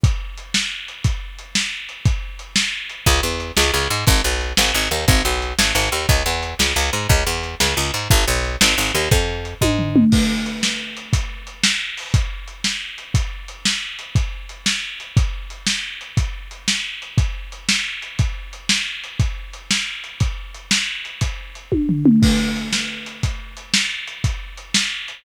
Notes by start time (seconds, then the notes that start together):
0.04 kick, closed hi-hat
0.37 closed hi-hat
0.54 snare
0.88 closed hi-hat
1.04 kick, closed hi-hat
1.39 closed hi-hat
1.55 snare
1.89 closed hi-hat
2.05 kick, closed hi-hat
2.39 closed hi-hat
2.56 snare
2.89 closed hi-hat
3.06 C#2, kick, closed hi-hat
3.23 E2
3.40 closed hi-hat
3.57 C#2, snare
3.74 C#2
3.90 G#2, closed hi-hat
4.07 G#1, kick, closed hi-hat
4.24 B1
4.41 closed hi-hat
4.57 G#1, snare
4.74 G#1
4.91 D#2, closed hi-hat
5.08 G#1, kick, closed hi-hat
5.25 B1
5.42 closed hi-hat
5.59 G#1, snare
5.75 G#1
5.92 D#2, closed hi-hat
6.09 C#2, kick, closed hi-hat
6.26 E2
6.43 closed hi-hat
6.59 C#2, snare
6.76 C#2
6.93 G#2, closed hi-hat
7.09 C#2, kick, closed hi-hat
7.27 E2
7.43 closed hi-hat
7.60 C#2, snare
7.77 C#2
7.94 G#2, closed hi-hat
8.10 G#1, kick, closed hi-hat
8.28 B1
8.44 closed hi-hat
8.61 G#1, snare
8.78 G#1
8.95 D#2, closed hi-hat
9.11 F2, kick, closed hi-hat
9.45 closed hi-hat
9.61 G#2, kick, high tom
9.79 floor tom
9.96 mid tom
10.12 kick, crash
10.46 closed hi-hat
10.63 snare
10.97 closed hi-hat
11.13 kick, closed hi-hat
11.47 closed hi-hat
11.64 snare
11.97 open hi-hat
12.14 kick, closed hi-hat
12.48 closed hi-hat
12.64 snare
12.98 closed hi-hat
13.14 kick, closed hi-hat
13.48 closed hi-hat
13.65 snare
13.99 closed hi-hat
14.15 kick, closed hi-hat
14.49 closed hi-hat
14.66 snare
15.00 closed hi-hat
15.17 kick, closed hi-hat
15.50 closed hi-hat
15.67 snare
16.01 closed hi-hat
16.17 kick, closed hi-hat
16.51 closed hi-hat
16.68 snare
17.02 closed hi-hat
17.18 kick, closed hi-hat
17.52 closed hi-hat
17.69 snare
18.02 closed hi-hat
18.19 kick, closed hi-hat
18.53 closed hi-hat
18.69 snare
19.04 closed hi-hat
19.20 kick, closed hi-hat
19.53 closed hi-hat
19.71 snare
20.04 closed hi-hat
20.20 kick, closed hi-hat
20.54 closed hi-hat
20.71 snare
21.05 closed hi-hat
21.21 kick, closed hi-hat
21.55 closed hi-hat
21.72 kick, high tom
21.89 floor tom
22.06 mid tom
22.22 kick, crash
22.56 closed hi-hat
22.73 snare
23.06 closed hi-hat
23.23 kick, closed hi-hat
23.57 closed hi-hat
23.74 snare
24.07 closed hi-hat
24.24 kick, closed hi-hat
24.57 closed hi-hat
24.74 snare
25.08 closed hi-hat